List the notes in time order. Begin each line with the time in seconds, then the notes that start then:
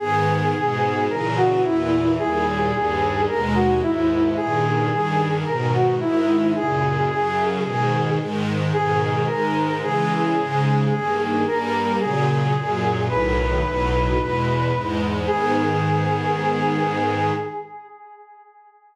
0.00 G#2 D#3 B3 G#4
0.55 G#2 B2 B3
1.09 A#2 C#3 E3 A#4
1.36 F#4
1.64 E2 A#2 E3 E4
2.18 D#2 A#2 G3 G#4
2.73 D#2 G2 G3
3.27 D#2 B2 G#3 A#4
3.55 F#4
3.81 D#2 G#2 G#3 E4
4.36 G2 A#2 D#3 G#4
4.91 G2 D#3 G3
5.45 G#2 B2 D#3 A#4
5.73 F#4
6.00 G#2 D#3 G#3 E4
6.55 F#2 A#2 C#3 G#4
7.09 F#2 C#3 F#3
7.64 G#2 B2 D#3 G#4
8.18 G#2 D#3 G#3
8.73 G#2 B2 D#3 G#4
9.00 G#4
9.27 G#2 D#3 G#3 A#4
9.82 C#3 E3 G#3 G#4
10.36 G#2 C#3 G#3
10.91 G2 D#3 A#3 G#4
11.18 G#4
11.45 G2 G3 A#3 A#4
12.00 A#2 C#3 F#3 G#4
12.55 F#2 A#2 F#3
13.08 B1 A2 D#3 F#3 B4
13.64 B1 A2 B2 F#3
14.18 E2 B2 G#3
14.73 E2 G#2 G#3
15.27 G#2 D#3 B3 G#4